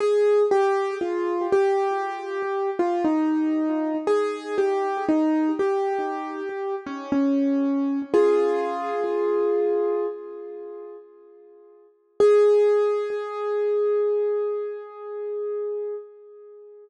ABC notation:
X:1
M:4/4
L:1/16
Q:1/4=59
K:Ab
V:1 name="Acoustic Grand Piano"
A2 G2 F2 G5 F E4 | A2 G2 E2 G5 D D4 | [FA]8 z8 | A16 |]